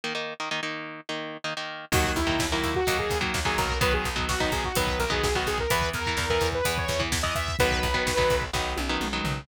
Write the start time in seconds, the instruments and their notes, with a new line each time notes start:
0.04 overdriven guitar D#3 A#3 D#4
0.15 overdriven guitar D#3 A#3 D#4
0.40 overdriven guitar D#3 A#3 D#4
0.51 overdriven guitar D#3 A#3 D#4
0.63 overdriven guitar D#3 A#3 D#4
1.09 overdriven guitar D#3 A#3 D#4
1.44 overdriven guitar D#3 A#3 D#4
1.57 overdriven guitar D#3 A#3 D#4
1.92 electric bass (finger) D#2, overdriven guitar D#3 F#3 A#3, lead 2 (sawtooth) F#4, kick, crash
2.04 kick
2.16 electric bass (finger) D#2, lead 2 (sawtooth) E4, kick, closed hi-hat
2.27 overdriven guitar D#3 F#3 A#3, kick
2.39 electric bass (finger) D#2, kick, snare
2.52 overdriven guitar D#3 F#3 A#3, lead 2 (sawtooth) E4, kick
2.63 electric bass (finger) D#2, kick, closed hi-hat
2.75 lead 2 (sawtooth) F#4, kick
2.87 electric bass (finger) D#2, overdriven guitar D#3 F#3 A#3, kick, closed hi-hat
2.99 lead 2 (sawtooth) G#4, kick
3.10 electric bass (finger) D#2, kick, closed hi-hat
3.21 overdriven guitar D#3 F#3 A#3, kick
3.34 electric bass (finger) D#2, kick, snare
3.45 overdriven guitar D#3 F#3 A#3, lead 2 (sawtooth) G#4, kick
3.58 electric bass (finger) B1, lead 2 (sawtooth) A#4, kick, closed hi-hat
3.69 kick
3.81 overdriven guitar D#3 F#3 B3, lead 2 (sawtooth) B4, kick, closed hi-hat
3.93 lead 2 (sawtooth) G#4, kick
4.05 electric bass (finger) B1, kick, closed hi-hat
4.16 overdriven guitar D#3 F#3 B3, kick
4.29 electric bass (finger) B1, lead 2 (sawtooth) F#4, kick, snare
4.40 overdriven guitar D#3 F#3 B3, lead 2 (sawtooth) D#4, kick
4.52 electric bass (finger) B1, lead 2 (sawtooth) G#4, kick, closed hi-hat
4.64 lead 2 (sawtooth) F#4, kick
4.75 electric bass (finger) B1, overdriven guitar D#3 F#3 B3, lead 2 (sawtooth) B4, kick, closed hi-hat
4.87 kick
4.99 electric bass (finger) B1, lead 2 (sawtooth) A#4, kick, closed hi-hat
5.10 overdriven guitar D#3 F#3 B3, lead 2 (sawtooth) G#4, kick
5.24 electric bass (finger) B1, lead 2 (sawtooth) G#4, kick, snare
5.35 overdriven guitar D#3 F#3 B3, lead 2 (sawtooth) F#4, kick
5.47 electric bass (finger) B1, lead 2 (sawtooth) G#4, kick, closed hi-hat
5.58 lead 2 (sawtooth) A#4, kick
5.70 electric bass (finger) E2, overdriven guitar E3 B3, lead 2 (sawtooth) B4, kick, closed hi-hat
5.82 kick
5.94 electric bass (finger) E2, lead 2 (sawtooth) A#4, kick, closed hi-hat
6.06 overdriven guitar E3 B3, kick
6.17 electric bass (finger) E2, kick, snare
6.30 overdriven guitar E3 B3, lead 2 (sawtooth) A#4, kick
6.41 electric bass (finger) E2, kick, closed hi-hat
6.52 lead 2 (sawtooth) B4, kick
6.65 electric bass (finger) E2, overdriven guitar E3 B3, kick, closed hi-hat
6.78 lead 2 (sawtooth) C#5, kick
6.88 electric bass (finger) E2, kick, closed hi-hat
7.00 overdriven guitar E3 B3, kick
7.12 electric bass (finger) E2, kick, snare
7.23 overdriven guitar E3 B3, lead 2 (sawtooth) D#5, kick
7.35 electric bass (finger) E2, lead 2 (sawtooth) E5, kick, closed hi-hat
7.48 kick
7.59 electric bass (finger) B1, overdriven guitar D#3 F#3 B3, lead 2 (sawtooth) B4, kick, closed hi-hat
7.71 kick
7.83 electric bass (finger) B1, kick, closed hi-hat
7.94 overdriven guitar D#3 F#3 B3, kick
8.07 electric bass (finger) B1, kick, snare
8.17 overdriven guitar D#3 F#3 B3, kick
8.30 electric bass (finger) B1, kick, closed hi-hat
8.42 kick
8.53 electric bass (finger) B1, overdriven guitar D#3 F#3 B3, kick, snare
8.77 electric bass (finger) B1, high tom
8.89 overdriven guitar D#3 F#3 B3
9.01 electric bass (finger) B1, mid tom
9.13 overdriven guitar D#3 F#3 B3
9.24 electric bass (finger) B1, floor tom